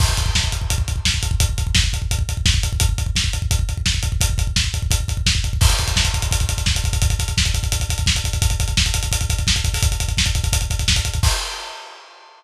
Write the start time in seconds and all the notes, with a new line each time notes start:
0.00 kick, crash
0.09 kick
0.17 kick, closed hi-hat
0.26 kick
0.35 kick, snare
0.44 kick
0.52 kick, closed hi-hat
0.62 kick
0.70 kick, closed hi-hat
0.78 kick
0.88 kick, closed hi-hat
0.96 kick
1.05 kick, snare
1.14 kick
1.23 kick, closed hi-hat
1.31 kick
1.40 kick, closed hi-hat
1.49 kick
1.58 kick, closed hi-hat
1.67 kick
1.75 kick, snare
1.84 kick
1.93 kick, closed hi-hat
2.02 kick
2.11 kick, closed hi-hat
2.19 kick
2.29 kick, closed hi-hat
2.37 kick
2.46 kick, snare
2.54 kick
2.63 kick, closed hi-hat
2.73 kick
2.80 kick, closed hi-hat
2.89 kick
2.98 kick, closed hi-hat
3.06 kick
3.16 kick, snare
3.24 kick
3.33 kick, closed hi-hat
3.42 kick
3.51 kick, closed hi-hat
3.59 kick
3.69 kick, closed hi-hat
3.77 kick
3.86 kick, snare
3.94 kick
4.03 kick, closed hi-hat
4.12 kick
4.21 kick, closed hi-hat
4.30 kick
4.38 kick, closed hi-hat
4.47 kick
4.56 kick, snare
4.64 kick
4.74 kick, closed hi-hat
4.82 kick
4.91 kick, closed hi-hat
5.00 kick
5.08 kick, closed hi-hat
5.17 kick
5.26 kick, snare
5.35 kick
5.44 kick, closed hi-hat
5.53 kick
5.61 kick, crash
5.70 kick, closed hi-hat
5.79 kick, closed hi-hat
5.88 kick, closed hi-hat
5.96 kick, snare
6.05 kick, closed hi-hat
6.14 kick, closed hi-hat
6.22 kick, closed hi-hat
6.31 kick, closed hi-hat
6.40 kick, closed hi-hat
6.49 kick, closed hi-hat
6.58 kick, closed hi-hat
6.66 kick, snare
6.75 kick, closed hi-hat
6.84 kick, closed hi-hat
6.93 kick, closed hi-hat
7.02 kick, closed hi-hat
7.10 kick, closed hi-hat
7.19 kick, closed hi-hat
7.28 kick, closed hi-hat
7.37 kick, snare
7.45 kick, closed hi-hat
7.54 kick, closed hi-hat
7.63 kick, closed hi-hat
7.72 kick, closed hi-hat
7.80 kick, closed hi-hat
7.89 kick, closed hi-hat
7.98 kick, closed hi-hat
8.06 kick, snare
8.15 kick, closed hi-hat
8.24 kick, closed hi-hat
8.33 kick, closed hi-hat
8.42 kick, closed hi-hat
8.50 kick, closed hi-hat
8.60 kick, closed hi-hat
8.68 kick, closed hi-hat
8.77 kick, snare
8.86 kick, closed hi-hat
8.94 kick, closed hi-hat
9.03 kick, closed hi-hat
9.12 kick, closed hi-hat
9.21 kick, closed hi-hat
9.30 kick, closed hi-hat
9.39 kick, closed hi-hat
9.47 kick, snare
9.56 kick, closed hi-hat
9.64 kick, closed hi-hat
9.74 kick, open hi-hat
9.83 kick, closed hi-hat
9.92 kick, closed hi-hat
10.00 kick, closed hi-hat
10.08 kick, closed hi-hat
10.17 kick, snare
10.26 kick, closed hi-hat
10.35 kick, closed hi-hat
10.44 kick, closed hi-hat
10.53 kick, closed hi-hat
10.61 kick, closed hi-hat
10.70 kick, closed hi-hat
10.79 kick, closed hi-hat
10.88 kick, snare
10.96 kick, closed hi-hat
11.05 kick, closed hi-hat
11.14 kick, closed hi-hat
11.23 kick, crash